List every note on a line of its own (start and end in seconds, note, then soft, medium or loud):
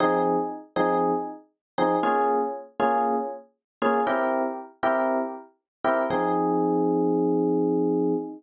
0.00 0.36 F3 loud
0.00 0.36 C4 medium
0.00 0.36 D#4 loud
0.00 0.36 G#4 loud
0.76 1.12 F3 medium
0.76 1.12 C4 medium
0.76 1.12 D#4 medium
0.76 1.12 G#4 medium
1.78 1.96 F3 medium
1.78 1.96 C4 medium
1.78 1.96 D#4 loud
1.78 1.96 G#4 medium
2.03 2.39 A#3 medium
2.03 2.39 C#4 loud
2.03 2.39 F4 loud
2.03 2.39 G#4 loud
2.80 3.15 A#3 medium
2.80 3.15 C#4 medium
2.80 3.15 F4 medium
2.80 3.15 G#4 medium
3.82 4.00 A#3 loud
3.82 4.00 C#4 medium
3.82 4.00 F4 medium
3.82 4.00 G#4 medium
4.07 4.42 C4 loud
4.07 4.42 E4 loud
4.07 4.42 G4 loud
4.07 4.42 A#4 loud
4.83 5.19 C4 medium
4.83 5.19 E4 medium
4.83 5.19 G4 medium
4.83 5.19 A#4 medium
5.84 6.02 C4 medium
5.84 6.02 E4 loud
5.84 6.02 G4 medium
5.84 6.02 A#4 medium
6.10 8.14 F3 loud
6.10 8.14 C4 loud
6.10 8.14 D#4 medium
6.10 8.14 G#4 loud